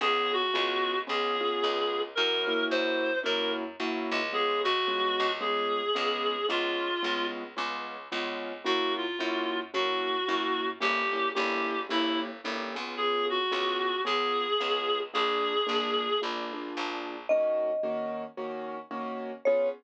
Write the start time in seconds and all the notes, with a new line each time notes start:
0.01 C#2 B3 C#4 F4 G#4
0.33 F#4
0.54 C#2 B3 C#4 F4 G#4
1.07 C#2 B3 C#4 F4 G#4
1.40 B3 C#4 F4 G#4
1.64 C#2
2.15 F#2 A#3 C#4 E4 F#4 A#4
2.47 A#3 C#4 E4 F#4
2.70 F#2 C5
3.23 F#2 A#3 C#4 E4 F#4 A#4
3.80 F#2 A#3 C#4 E4 F#4
4.11 C#2
4.32 G#3 B3 C#4 F4 G#4
4.64 C#2 F#4
4.87 G#3 B3 C#4 F4
5.20 C#2
5.41 G#3 B3 C#4 F4 G#4
5.95 C#2 G#3 B3 C#4 F4
6.49 C#2 G#3 B3 C#4 F4
7.03 C#2 G#3 B3 C#4 F4
7.57 C#2 G#3 B3 C#4 F4
8.12 C#2 G#3 B3 C#4 F4
8.64 F#2 A#3 C#4 E4 F#4
8.97 F4
9.19 F#2 A#3 C#4 E4 F#4
9.74 F#2 A#3 C#4 E4 F#4
10.28 F#2 A#3 C#4 E4 F#4
10.80 G1 A#3 C#4 E4 G4
11.12 A#3 C#4 E4 G4
11.34 G1 A#3 C#4 E4 G4
11.89 G1 A#3 C#4 E4 G4
12.44 G1 A#3 C#4 E4 G4
12.75 C#2 B3 C#4 F4 G#4
12.97 G#4
13.30 F#4
13.51 C#2 B3 C#4 F4 G#4
14.05 C#2 B3 C#4 F4 G#4
14.60 C#2 B3 C#4 F4 G#4
15.14 A#1 A#3 D4 F4 G#4
15.67 A#1 A#3 D4 F4 G#4
16.22 A#1 A#3 D4 F4 G#4
16.53 A#3 D4 F4 G#4
16.77 A#1
17.29 D#3 A#3 C#4 F#4 D#5
17.83 D#3 A#3 C#4 F#4
18.37 D#3 A#3 C#4 F#4
18.91 D#3 A#3 C#4 F#4
19.45 B3 C#4 F4 G#4 C#5